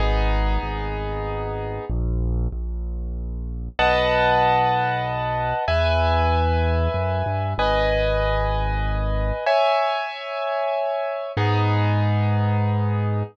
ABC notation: X:1
M:3/4
L:1/8
Q:1/4=95
K:G#m
V:1 name="Acoustic Grand Piano"
[B,DG]6 | z6 | [Bdf=a]6 | [Beg]6 |
[Bdg]6 | [ceg]6 | [B,DG]6 |]
V:2 name="Acoustic Grand Piano" clef=bass
G,,,2 G,,,4 | A,,,2 A,,,4 | B,,,6 | E,,4 F,, =G,, |
G,,,6 | z6 | G,,6 |]